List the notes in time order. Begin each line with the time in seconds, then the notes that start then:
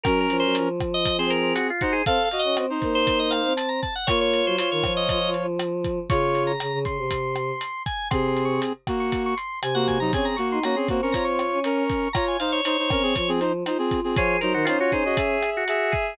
0.04 F#3 C#4 A#4, kick, cross-stick, closed hi-hat
0.21 A#4
0.30 F3, closed hi-hat
0.40 F#3 C5
0.55 F3, closed hi-hat
0.80 kick, cross-stick, closed hi-hat
0.94 D#5
1.06 kick, closed hi-hat
1.18 C4 G#4 C5
1.30 A#4, closed hi-hat
1.55 F#4, cross-stick, closed hi-hat
1.70 F4
1.81 D#4 F#4 C5, kick, closed hi-hat
1.93 G#4
2.06 C4 A4 F5, kick, closed hi-hat
2.25 F5
2.31 F#4 D#5, closed hi-hat
2.39 D#5
2.44 C#4
2.56 C4, cross-stick, closed hi-hat
2.70 D#4 C5
2.82 A#3, kick, closed hi-hat
2.95 C5
3.07 kick, closed hi-hat
3.19 D#5
3.31 F5, cross-stick, closed hi-hat
3.45 C4
3.57 A5, closed hi-hat
3.69 A#5
3.82 A5, kick, closed hi-hat
3.95 F#5
4.07 A#3 F4 C#5, kick, cross-stick, closed hi-hat
4.21 C#5
4.34 closed hi-hat
4.46 F#3 C5
4.57 F4 C5 C#5, closed hi-hat
4.71 D#3 C#5
4.84 F3, kick, cross-stick, closed hi-hat
4.97 D#5
5.09 D#5, kick, closed hi-hat
5.34 closed hi-hat
5.59 cross-stick, closed hi-hat
5.85 kick, closed hi-hat
6.10 C#3 F4 C#5 C#6, kick, closed hi-hat
6.35 closed hi-hat
6.47 A#5
6.60 C#3, cross-stick, closed hi-hat
6.72 C#3
6.85 C#3 C6, kick, closed hi-hat
6.98 C3
7.11 kick, closed hi-hat
7.36 cross-stick, closed hi-hat
7.61 closed hi-hat
7.86 G#5, kick, closed hi-hat
8.11 C3 C4 G#4 C6, kick, cross-stick, closed hi-hat
8.28 C6
8.37 closed hi-hat
8.45 C#6
8.62 closed hi-hat
8.87 A#3 F#4, kick, cross-stick, closed hi-hat
9.00 C#6
9.12 kick, closed hi-hat
9.26 C#6
9.37 C6, closed hi-hat
9.62 C3 G#5, cross-stick, closed hi-hat
9.75 A#3 F#4 F#5
9.88 G#5, kick, closed hi-hat
10.00 F#3 D#4 A#5
10.13 C4 C#4 G#4 G#5, kick, closed hi-hat
10.25 A#5
10.36 A#3 F#4 C#6, closed hi-hat
10.51 D#4 C6
10.63 A#3 C#4 F#4 A#5, cross-stick, closed hi-hat
10.76 C4 G#4 C6
10.88 A#3 C4 F#4, kick, closed hi-hat
11.02 C#4 A#4 C#6
11.12 F4 C#5 A#5, kick, closed hi-hat
11.25 C#6
11.39 cross-stick, closed hi-hat
11.52 C#4
11.64 C#4 A#4 C#6, closed hi-hat
11.78 C#6
11.90 kick, closed hi-hat
12.13 F4 C#5 A#5, kick, cross-stick, closed hi-hat
12.28 G#5
12.40 D#4 C5 F5, closed hi-hat
12.52 C#5
12.65 D#4 C5, closed hi-hat
12.79 D#4 C5
12.90 C4 C#4 A#4, kick, cross-stick, closed hi-hat
13.03 C4 G#4
13.16 F3, kick, closed hi-hat
13.28 C4 G#4
13.40 D#4 C5, closed hi-hat
13.66 D#4 F4 C5, cross-stick, closed hi-hat
13.78 C4 G#4
13.91 kick, closed hi-hat
14.04 C4 G#4
14.16 F3 F4 G#4 C#5, kick, closed hi-hat
14.41 F#3 D#4 A#4 C5, closed hi-hat
14.54 D#3 F#4
14.65 C#4 D#4 F4 C5, cross-stick, closed hi-hat
14.79 F4 F#4 C#5
14.92 D#4 G#4 C5, kick, closed hi-hat
15.05 F#4 D#5
15.17 G#4 E5, kick, closed hi-hat
15.43 cross-stick, closed hi-hat
15.57 F#4
15.68 G#4 E5, closed hi-hat
15.92 G#4, kick, closed hi-hat